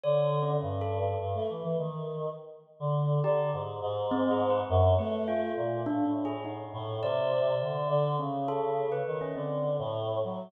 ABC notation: X:1
M:2/4
L:1/16
Q:1/4=103
K:none
V:1 name="Choir Aahs"
D,4 G,,4 | G,, A, E, E, ^D,4 | z3 D,3 D,2 | ^G,,2 G,,6 |
^F,,2 A,4 ^A,,2 | A,,6 A,,2 | C,4 D,2 D,2 | ^C,6 ^D,2 |
D,3 A,,3 ^F,2 |]
V:2 name="Tubular Bells"
(3^c4 ^C4 A4 | z8 | z6 G2 | z4 (3C2 ^G2 B2 |
z2 B2 F4 | (3D2 D2 ^G2 ^D4 | d8 | ^C2 A3 B2 C |
C2 z6 |]